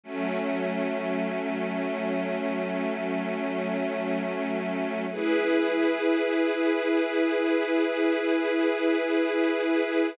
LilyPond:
\new Staff { \time 3/4 \key e \major \tempo 4 = 71 <fis a cis'>2.~ | <fis a cis'>2. | <e' gis' b'>2.~ | <e' gis' b'>2. | }